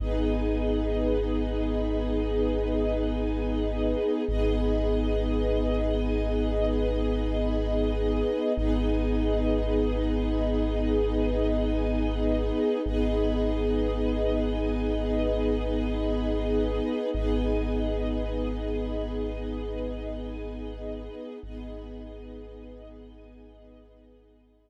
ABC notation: X:1
M:4/4
L:1/8
Q:1/4=56
K:G#m
V:1 name="Pad 2 (warm)"
[B,DG]8 | [B,DG]8 | [B,DG]8 | [B,DG]8 |
[B,DG]8 | [B,DG]8 |]
V:2 name="String Ensemble 1"
[GBd]8 | [GBd]8 | [GBd]8 | [GBd]8 |
[GBd]8 | [GBd]8 |]
V:3 name="Synth Bass 2" clef=bass
G,,,8 | G,,,8 | G,,,8 | G,,,8 |
G,,,8 | G,,,8 |]